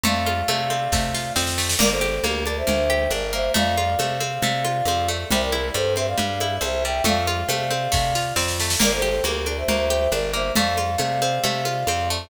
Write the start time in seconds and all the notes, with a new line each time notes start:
0.03 F2 A3 D5 F5, low conga
0.26 F4, high conga
0.48 C3 A3, high conga
0.70 C4, high conga
0.92 C3 A3, kick, snare
1.14 F4, snare
1.36 F2 C4, snare
1.47 snare
1.58 A3, snare
1.69 snare
1.79 G1 A#3 A#4 D5, crash, low conga
1.91 A4 C5
2.01 G4, high conga
2.24 D2 A#3 G4 A#4, high conga
2.46 D4 A#4 D5, high conga
2.57 C5 E5
2.67 D2 A#3, low conga
2.90 G4, high conga
3.10 G1 D4 A#4 D5, high conga
3.33 A#3 C5 E5
3.54 F2 A3 D5 F5, low conga
3.77 F4, high conga
3.99 C3 A3, high conga
4.20 C4, high conga
4.42 C3 A3, low conga
4.65 F4, high conga
4.85 F2 C4, high conga
5.08 A3
5.30 C2 G3 C5 E5, low conga
5.41 A#4 D5
5.52 E4, high conga
5.74 G2 G3 A4 C5, high conga
5.96 C4 C5 E5, high conga
6.08 D5 F5
6.18 G2 G3, low conga
6.40 E4, high conga
6.61 C2 C4 C5 E5, high conga
6.84 G3 E5 G5
7.04 F2 A3 D5 F5, low conga
7.27 F4, high conga
7.49 C3 A3, high conga
7.71 C4, high conga
7.92 C3 A3, kick, snare
8.15 F4, snare
8.36 F2 C4, snare
8.48 snare
8.60 A3, snare
8.70 snare
8.80 G1 A#3 A#4 D5, crash, low conga
8.93 A4 C5
9.02 G4, high conga
9.24 D2 A#3 G4 A#4, high conga
9.46 D4 A#4 D5, high conga
9.57 C5 E5
9.68 D2 A#3, low conga
9.90 G4, high conga
10.12 G1 D4 A#4 D5, high conga
10.33 A#3 C5 E5
10.55 F2 A3 D5 F5, low conga
10.77 F4, high conga
10.98 C3 A3, high conga
11.22 C4, high conga
11.44 C3 A3, low conga
11.65 F4, high conga
11.87 F2 C4, high conga
12.10 A3